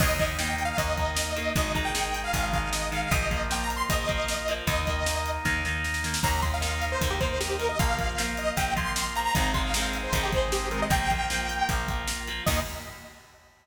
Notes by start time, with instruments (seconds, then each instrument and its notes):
0.00 electric bass (finger) D#2, overdriven guitar D#3 A#3, drawbar organ A#3 D#4, lead 2 (sawtooth) D#5, kick, crash
0.19 overdriven guitar D#3 A#3, kick, closed hi-hat
0.38 overdriven guitar D#3 A#3, lead 2 (sawtooth) G5, snare
0.51 lead 2 (sawtooth) G5
0.58 closed hi-hat
0.65 lead 2 (sawtooth) F5
0.77 electric bass (finger) D#2, overdriven guitar D#3 A#3, lead 2 (sawtooth) D#5, kick, closed hi-hat
0.97 overdriven guitar D#3 A#3, kick, closed hi-hat
1.16 snare
1.36 overdriven guitar D#3 A#3, closed hi-hat
1.56 electric bass (finger) G#1, overdriven guitar D#3 G#3, drawbar organ G#3 D#4, lead 2 (sawtooth) D#5, kick, closed hi-hat
1.74 overdriven guitar D#3 G#3, lead 2 (sawtooth) A#5, kick, closed hi-hat
1.85 lead 2 (sawtooth) G5
1.94 overdriven guitar D#3 G#3, snare
2.15 closed hi-hat
2.24 lead 2 (sawtooth) F5
2.33 electric bass (finger) G#1, overdriven guitar D#3 G#3, kick, closed hi-hat
2.43 lead 2 (sawtooth) F5
2.53 overdriven guitar D#3 G#3, lead 2 (sawtooth) F5, kick, closed hi-hat
2.73 lead 2 (sawtooth) D#5, snare
2.92 overdriven guitar D#3 G#3, lead 2 (sawtooth) F5, closed hi-hat
3.02 lead 2 (sawtooth) F5
3.11 electric bass (finger) A#1, overdriven guitar F3 A#3, drawbar organ A#3 F4, lead 2 (sawtooth) D#5, kick, closed hi-hat
3.31 overdriven guitar F3 A#3, kick, closed hi-hat
3.50 overdriven guitar F3 A#3, lead 2 (sawtooth) G5, snare
3.64 lead 2 (sawtooth) A#5
3.70 closed hi-hat
3.76 lead 2 (sawtooth) C6
3.90 electric bass (finger) A#1, overdriven guitar F3 A#3, lead 2 (sawtooth) D#5, kick, closed hi-hat
4.08 overdriven guitar F3 A#3, kick, closed hi-hat
4.28 snare
4.48 overdriven guitar F3 A#3, closed hi-hat
4.67 electric bass (finger) D#2, overdriven guitar D#3 A#3, drawbar organ A#3 D#4, lead 2 (sawtooth) D#5, kick, closed hi-hat
4.87 overdriven guitar D#3 A#3, kick, closed hi-hat
5.06 overdriven guitar D#3 A#3, snare
5.26 closed hi-hat
5.45 electric bass (finger) D#2, overdriven guitar D#3 A#3, kick, snare
5.65 overdriven guitar D#3 A#3, snare
5.84 snare
5.94 snare
6.04 overdriven guitar D#3 A#3, snare
6.14 snare
6.23 electric bass (finger) D#2, overdriven guitar D#3 A#3, drawbar organ A#3 D#4, lead 2 (sawtooth) A#5, kick, crash
6.42 overdriven guitar D#3 A#3, lead 2 (sawtooth) C6, kick, closed hi-hat
6.54 lead 2 (sawtooth) F5
6.61 overdriven guitar D#3 A#3, snare
6.82 closed hi-hat
6.92 lead 2 (sawtooth) C5
7.01 electric bass (finger) D#2, overdriven guitar D#3 A#3, kick, closed hi-hat
7.10 lead 2 (sawtooth) G4
7.20 overdriven guitar D#3 A#3, lead 2 (sawtooth) C5, kick, closed hi-hat
7.40 lead 2 (sawtooth) G4, snare
7.59 overdriven guitar D#3 A#3, lead 2 (sawtooth) A#4, closed hi-hat
7.69 lead 2 (sawtooth) D#5
7.79 electric bass (finger) A#1, overdriven guitar F3 A#3, drawbar organ A#3 F4, lead 2 (sawtooth) F5, kick, closed hi-hat
7.98 overdriven guitar F3 A#3, kick, closed hi-hat
8.18 overdriven guitar F3 A#3, snare
8.37 lead 2 (sawtooth) D#5, closed hi-hat
8.57 electric bass (finger) A#1, overdriven guitar F3 A#3, lead 2 (sawtooth) G5, kick, closed hi-hat
8.76 overdriven guitar F3 A#3, lead 2 (sawtooth) C6, kick, closed hi-hat
8.96 snare
9.16 overdriven guitar F3 A#3, lead 2 (sawtooth) A#5, closed hi-hat
9.34 electric bass (finger) G#1, overdriven guitar D#3 G#3 C4, drawbar organ G#3 C4 D#4, lead 2 (sawtooth) A#5, kick, closed hi-hat
9.54 overdriven guitar D#3 G#3 C4, lead 2 (sawtooth) C6, kick, closed hi-hat
9.64 lead 2 (sawtooth) F5
9.74 overdriven guitar D#3 G#3, snare
9.78 overdriven guitar C4
9.93 closed hi-hat
10.04 lead 2 (sawtooth) C5
10.12 electric bass (finger) G#1, overdriven guitar D#3 G#3, kick, closed hi-hat
10.17 overdriven guitar C4
10.23 lead 2 (sawtooth) G4
10.32 overdriven guitar D#3 G#3, lead 2 (sawtooth) C5, kick, closed hi-hat
10.37 overdriven guitar C4
10.52 lead 2 (sawtooth) G4, snare
10.71 overdriven guitar D#3 G#3 C4, lead 2 (sawtooth) A#4, closed hi-hat
10.82 lead 2 (sawtooth) D#5
10.90 electric bass (finger) A#1, overdriven guitar F3 A#3, drawbar organ A#3 F4, lead 2 (sawtooth) G5, kick, closed hi-hat
11.10 overdriven guitar F3 A#3, kick, closed hi-hat
11.30 overdriven guitar F3 A#3, snare
11.49 closed hi-hat
11.69 electric bass (finger) A#1, overdriven guitar F3 A#3, kick, closed hi-hat
11.88 overdriven guitar F3 A#3, kick, closed hi-hat
12.08 snare
12.28 overdriven guitar F3 A#3, closed hi-hat
12.46 electric bass (finger) D#2, overdriven guitar D#3 A#3, drawbar organ A#3 D#4, lead 2 (sawtooth) D#5, kick, crash